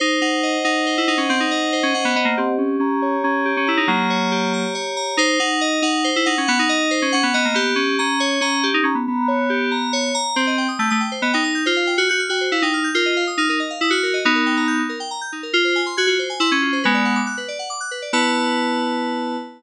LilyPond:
<<
  \new Staff \with { instrumentName = "Electric Piano 2" } { \time 3/4 \key fis \mixolydian \tempo 4 = 139 dis'8 dis'4 dis'8. e'16 dis'16 cis'16 | bis16 dis'4 cis'16 cis'16 b16 b16 ais16 bis8 | des'8 des'4 des'8. des'16 e'16 dis'16 | <fis bes>2 r4 |
dis'8 dis'4 dis'8. e'16 dis'16 cis'16 | b16 dis'4 cis'16 cis'16 b16 b16 ais16 b8 | des'8 des'4 des'8. dis'16 des'16 b16 | b2~ b8 r8 |
\key b \mixolydian c'8. r16 a16 a16 r8 b16 ees'8. | f'8. fis'16 fis'16 r16 fis'8 e'16 dis'8. | eis'8. r16 dis'16 dis'16 r8 e'16 fis'8. | <b dis'>4. r4. |
eis'8. r16 fis'16 fis'16 r8 e'16 cis'8. | <gis b>4 r2 | b2. | }
  \new Staff \with { instrumentName = "Electric Piano 2" } { \time 3/4 \key fis \mixolydian bis'8 fis''8 dis''8 fis''8 bis'8 fis''8 | fis''8 dis''8 bis'8 fis''8 dis''8 g'8~ | g'8 bes''8 des''8 bes''8 g'8 bes''8 | bes''8 des''8 g'8 bes''8 des''8 bes''8 |
bis'8 fis''8 dis''8 fis''8 bis'8 fis''8 | fis''8 dis''8 bis'8 fis''8 dis''8 g'8~ | g'8 bes''8 des''8 bes''8 g'8 bes''8 | bes''8 des''8 g'8 bes''8 des''8 bes''8 |
\key b \mixolydian c''16 ees''16 g''16 ees'''16 g'''16 ees'''16 g''16 c''16 ees''16 g''16 ees'''16 g'''16 | c''16 f''16 g''16 f'''16 g'''16 f'''16 g''16 c''16 f''16 g''16 f'''16 g'''16 | ais'16 dis''16 eis''16 dis'''16 eis'''16 ais'16 dis''16 eis''16 dis'''16 eis'''16 ais'16 dis''16 | r16 ais'16 g''16 ais''16 g'''16 dis'16 ais'16 g''16 ais''16 g'''16 dis'16 ais'16 |
r16 bis'16 gis''16 bis''16 gis'''16 eis'16 bis'16 gis''16 bis''16 gis'''16 eis'16 bis'16 | b'16 d''16 fis''16 d'''16 fis'''16 b'16 d''16 fis''16 d'''16 fis'''16 b'16 d''16 | <e' b' a''>2. | }
>>